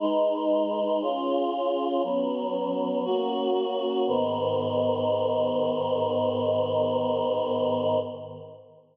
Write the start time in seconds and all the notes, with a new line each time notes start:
0.00 G#3 D#4 B4
1.02 C#4 F4 G#4
2.03 F#3 B3 C#4
3.05 A#3 C#4 F#4
4.07 G#2 D#3 B3